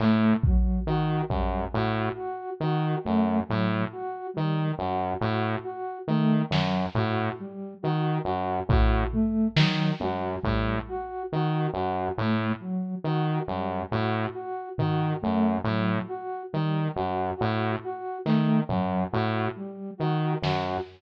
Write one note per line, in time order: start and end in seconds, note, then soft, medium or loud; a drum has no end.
0.00 0.33 A2 medium
0.00 0.36 A3 medium
0.00 clap medium
0.43 0.80 F#3 medium
0.43 kick medium
0.87 1.22 D#3 medium
0.87 1.22 F#4 medium
1.29 1.65 F#2 medium
1.29 1.64 G3 medium
1.29 kick medium
1.73 2.09 A2 medium
1.73 2.08 F#4 medium
2.15 2.50 F#4 medium
2.60 2.95 D#3 medium
2.60 2.97 F#4 medium
3.04 3.40 F#2 medium
3.04 3.39 A3 medium
3.48 3.85 A2 medium
3.48 3.83 F#3 medium
3.92 4.27 F#4 medium
4.34 4.72 D#3 medium
4.34 4.68 G3 medium
4.79 5.13 F#2 medium
4.79 5.14 F#4 medium
5.20 5.56 A2 medium
5.20 5.55 F#4 medium
5.64 5.99 F#4 medium
6.08 6.42 D#3 medium
6.08 6.43 A3 medium
6.50 6.86 F#2 medium
6.50 6.85 F#3 medium
6.50 snare medium
6.95 7.30 A2 medium
6.95 7.32 F#4 medium
6.95 floor tom medium
7.39 7.74 G3 medium
7.82 8.18 D#3 medium
7.82 8.17 F#4 medium
8.24 8.60 F#2 medium
8.24 8.59 F#4 medium
8.69 9.04 A2 medium
8.69 9.05 F#4 medium
8.69 kick medium
9.13 9.47 A3 medium
9.13 floor tom soft
9.56 9.91 D#3 medium
9.56 9.92 F#3 medium
9.56 snare loud
10.00 10.36 F#2 medium
10.00 10.36 F#4 medium
10.00 high tom medium
10.42 10.79 A2 medium
10.42 10.77 G3 medium
10.42 kick medium
10.88 11.23 F#4 medium
11.32 11.67 D#3 medium
11.32 11.67 F#4 medium
11.74 12.08 F#2 medium
11.74 12.09 F#4 medium
12.17 12.53 A2 medium
12.17 12.52 A3 medium
12.60 12.95 F#3 medium
13.04 13.39 D#3 medium
13.04 13.40 F#4 medium
13.47 13.83 F#2 medium
13.47 13.82 G3 medium
13.91 14.26 A2 medium
13.91 14.26 F#4 medium
14.34 14.69 F#4 medium
14.78 15.13 D#3 medium
14.78 15.14 F#4 medium
14.78 floor tom medium
15.22 15.58 F#2 medium
15.22 15.57 A3 medium
15.64 15.99 A2 medium
15.64 16.02 F#3 medium
16.08 16.43 F#4 medium
16.53 16.88 D#3 medium
16.53 16.87 G3 medium
16.96 17.31 F#2 medium
16.96 17.30 F#4 medium
17.37 17.76 A2 medium
17.37 17.72 F#4 medium
17.84 18.18 F#4 medium
18.25 18.61 D#3 medium
18.25 18.60 A3 medium
18.25 clap medium
18.69 19.04 F#2 medium
18.69 19.03 F#3 medium
18.69 floor tom medium
19.11 19.48 A2 medium
19.11 19.46 F#4 medium
19.56 19.91 G3 medium
19.98 20.35 D#3 medium
19.98 20.33 F#4 medium
20.42 20.77 F#2 medium
20.42 20.78 F#4 medium
20.42 snare medium